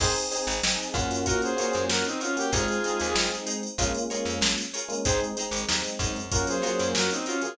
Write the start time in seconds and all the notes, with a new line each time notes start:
0.00 G#1 C4 D#4 G#4 C5, kick, crash
0.16 closed hi-hat
0.31 C4 D#4 G#4 C5, closed hi-hat
0.47 G#1, closed hi-hat
0.63 G#1 C4 D#4 G#4, snare
0.79 closed hi-hat
0.94 F#2 A#3 C#4 D#4 F4 F#4 G#4 C5, kick, closed hi-hat
1.11 snare, closed hi-hat
1.26 F4 F#4 A#4 C#5, kick, closed hi-hat
1.42 G#4 C5, closed hi-hat
1.57 A#3 C#4 F4 F#4 A#4 C#5, closed hi-hat
1.61 F4 F#4
1.73 F#2, closed hi-hat
1.89 F#2 F#4 A#4, snare
2.05 C4 D#4, closed hi-hat
2.21 C#4 F4 F#4 A#4 C#5, closed hi-hat
2.37 A#3 C#4 F4 F#4 G4, closed hi-hat
2.52 G#1 G#3 C4 D#4 F4 G#4 C5, kick, closed hi-hat
2.68 closed hi-hat
2.84 G#3 C4 D#4 G#4 C5, closed hi-hat
3.00 D#2, closed hi-hat
3.15 G#1 G#3 C4 D#4, snare
3.32 closed hi-hat
3.46 D#4 G#4 C5, closed hi-hat
3.63 closed hi-hat
3.78 A#1 G#3 A#3 C#4 F4 G#4 A#4 C#5, kick, closed hi-hat
3.95 closed hi-hat
4.10 G#3 A#3 C#4 F4 G#4 A#4 C#5, closed hi-hat
4.25 F2, snare, closed hi-hat
4.41 A#1, snare
4.58 closed hi-hat
4.74 F4 G#4 A#4 C#5, closed hi-hat
4.88 G#3 A#3 C#4 F4, closed hi-hat
5.05 G#1 G#3 C4 D#4 G#4 C5, kick, closed hi-hat
5.20 closed hi-hat
5.37 G#3 C4 D#4 G#4 C5, closed hi-hat
5.51 G#1, closed hi-hat
5.69 D#2 G#3 C4 D#4, snare
5.84 closed hi-hat
5.99 F#2 D#4 G#4 C5, kick, closed hi-hat
6.16 closed hi-hat
6.31 F#3 A#3 C#4 F4 F#4 A#4 C#5, kick, closed hi-hat
6.47 G#4 C5, snare, closed hi-hat
6.62 F#3 A#3 C#4 F4 F#4 A#4 C#5, snare, closed hi-hat
6.79 F#2, closed hi-hat
6.95 F#2 F#4 A#4, snare
7.11 C4 D#4, closed hi-hat
7.26 C#4 F4 F#4 A#4 C#5, closed hi-hat
7.41 F#3 A#3 C#4 F4 G#4, snare, closed hi-hat